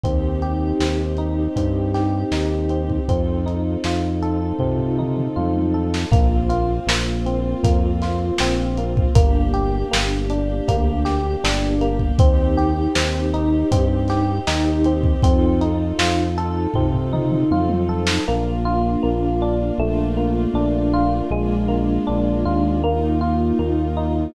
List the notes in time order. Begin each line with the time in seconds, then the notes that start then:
0.03 D#2 C4 D#4 G4, kick, closed hi-hat
0.42 G4, closed hi-hat
0.80 D#2 C4, snare
1.17 D#4, closed hi-hat
1.56 G2 C4, kick, closed hi-hat
1.94 G4, snare, closed hi-hat
2.31 D#2 D#4, snare
2.69 C4, closed hi-hat
2.90 kick
3.08 F2 C4 D#4 F4 A4, kick, closed hi-hat
3.46 D#4, closed hi-hat
3.84 F2 F4, snare
4.22 A4, closed hi-hat
4.59 C3 C4, kick, floor tom
4.79 floor tom
4.99 D#4, mid tom
5.17 mid tom
5.36 F2 F4, high tom
5.55 high tom
5.74 A4
5.94 snare
6.11 A#1 A#3 C4 F4, kick, closed hi-hat
6.49 F4, closed hi-hat
6.87 A#1 A#3, snare
7.26 C4, closed hi-hat
7.63 F2 A#3, kick, closed hi-hat
8.02 F4, snare, closed hi-hat
8.38 A#1 C4, snare
8.78 A#3, closed hi-hat
8.97 kick
9.15 G1 A#3 D4 G4, kick, closed hi-hat
9.53 G4, closed hi-hat
9.91 G1 A#3, snare
10.30 D4, closed hi-hat
10.68 D2 A#3, kick, closed hi-hat
11.05 G4, snare, closed hi-hat
11.44 G1 D4, snare
11.81 A#3, closed hi-hat
11.99 kick
12.19 D#2 C4 D#4 G4, kick, closed hi-hat
12.57 G4, closed hi-hat
12.95 D#2 C4, snare
13.34 D#4, closed hi-hat
13.71 G2 C4, kick, closed hi-hat
14.08 G4, snare, closed hi-hat
14.47 D#2 D#4, snare
14.84 C4, closed hi-hat
15.03 kick
15.22 F2 C4 D#4 F4 A4, kick, closed hi-hat
15.61 D#4, closed hi-hat
15.99 F2 F4, snare
16.38 A4, closed hi-hat
16.74 C3 C4, kick, floor tom
16.94 floor tom
17.13 D#4, mid tom
17.31 mid tom
17.51 F2 F4, high tom
17.69 high tom
17.89 A4
18.07 snare
18.28 A#1 A#3 D4 F4
18.65 F4
19.03 A#1 A#3
19.42 D4
19.78 A#1 A3 A#3 D4 F4
20.17 A#3
20.54 A#1 D4
20.94 F4
21.31 A#1 G#3 A#3 D4 F4
21.68 A#3
22.07 A#1 D4
22.45 D#2 F4
22.83 A#3 D#4 F4
23.21 F4
23.59 D#2 A#3
23.97 D#4